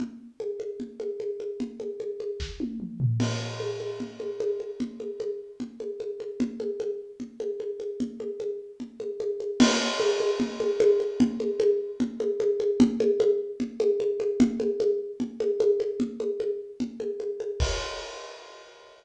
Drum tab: CC |--------|--------|x-------|--------|
SD |--------|----o---|--------|--------|
T1 |--------|-----o--|--------|--------|
T2 |--------|------o-|--------|--------|
FT |--------|-------o|--------|--------|
CG |O-ooOooo|Oooo----|O-ooOooo|Ooo-Oooo|
BD |--------|----o---|--------|--------|

CC |--------|--------|x-------|--------|
SD |--------|--------|--------|--------|
T1 |--------|--------|--------|--------|
T2 |--------|--------|--------|--------|
FT |--------|--------|--------|--------|
CG |Ooo-Oooo|Ooo-Oooo|O-ooOooo|Ooo-Oooo|
BD |--------|--------|--------|--------|

CC |--------|--------|--------|x-------|
SD |--------|--------|--------|--------|
T1 |--------|--------|--------|--------|
T2 |--------|--------|--------|--------|
FT |--------|--------|--------|--------|
CG |Ooo-Oooo|Ooo-Oooo|Ooo-Oooo|--------|
BD |--------|--------|--------|o-------|